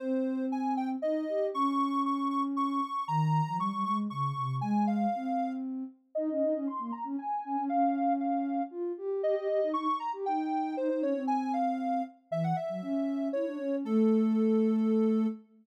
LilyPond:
<<
  \new Staff \with { instrumentName = "Ocarina" } { \time 3/4 \key aes \major \tempo 4 = 117 c''4 aes''8 g''16 r16 ees''4 | des'''4 des'''8 des'''16 r16 des'''4 | bes''4 des'''8 des'''16 r16 des'''4 | aes''8 f''4. r4 |
ees''4 c'''8 bes''16 r16 aes''4 | f''4 f''4 r4 | ees''4 des'''8 bes''16 r16 g''4 | c''16 c''16 des''8 aes''8 f''4 r8 |
\key a \major e''16 fis''16 e''4. cis''4 | a'2. | }
  \new Staff \with { instrumentName = "Ocarina" } { \time 3/4 \key aes \major c'2 ees'8 g'8 | des'2. | ees8. f16 g16 g16 aes8 des8 c8 | aes4 c'4. r8 |
ees'16 des'16 ees'16 des'16 r16 bes16 r16 des'16 r8 des'16 des'16 | des'2 f'8 g'8 | g'16 g'16 g'16 ees'16 ees'16 r8 g'16 ees'4 | ees'16 ees'16 des'16 c'4.~ c'16 r8 |
\key a \major e8 r16 fis16 cis'4 e'16 d'16 cis'8 | a2. | }
>>